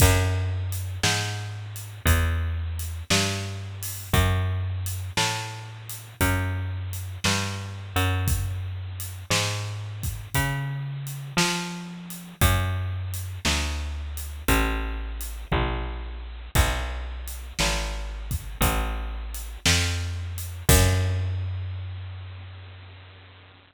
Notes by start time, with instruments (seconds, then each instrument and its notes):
0.00 electric bass (finger) F#2, kick, crash
0.72 closed hi-hat
1.03 electric bass (finger) G#2, snare
1.76 closed hi-hat
2.05 electric bass (finger) E2, kick, closed hi-hat
2.79 closed hi-hat
3.10 electric bass (finger) G2, snare
3.83 open hi-hat
4.13 electric bass (finger) F#2, kick, closed hi-hat
4.86 closed hi-hat
5.17 electric bass (finger) A2, snare
5.89 closed hi-hat
6.21 electric bass (finger) F#2, kick, closed hi-hat
6.93 closed hi-hat
7.24 electric bass (finger) G2, snare
7.96 electric bass (finger) F#2, closed hi-hat
8.28 kick, closed hi-hat
9.00 closed hi-hat
9.30 electric bass (finger) G#2, snare
10.03 kick, closed hi-hat
10.34 electric bass (finger) C#3, kick, closed hi-hat
11.07 closed hi-hat
11.37 electric bass (finger) F3, snare
12.10 closed hi-hat
12.41 electric bass (finger) F#2, kick, closed hi-hat
13.14 closed hi-hat
13.45 electric bass (finger) D2, snare
14.17 closed hi-hat
14.48 electric bass (finger) A1, kick, closed hi-hat
15.21 closed hi-hat
15.52 electric bass (finger) A#1, kick, floor tom
16.55 electric bass (finger) B1, kick, crash
17.28 closed hi-hat
17.59 electric bass (finger) G#1, snare
18.31 kick, closed hi-hat
18.61 electric bass (finger) A1, kick, closed hi-hat
19.34 closed hi-hat
19.66 electric bass (finger) F2, snare
20.38 closed hi-hat
20.69 electric bass (finger) F#2, kick, crash